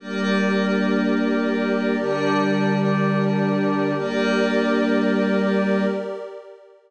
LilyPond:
<<
  \new Staff \with { instrumentName = "Pad 5 (bowed)" } { \time 3/4 \key g \phrygian \tempo 4 = 91 <g bes d'>2. | <d g d'>2. | <g bes d'>2. | }
  \new Staff \with { instrumentName = "Pad 2 (warm)" } { \time 3/4 \key g \phrygian <g' bes' d''>2.~ | <g' bes' d''>2. | <g' bes' d''>2. | }
>>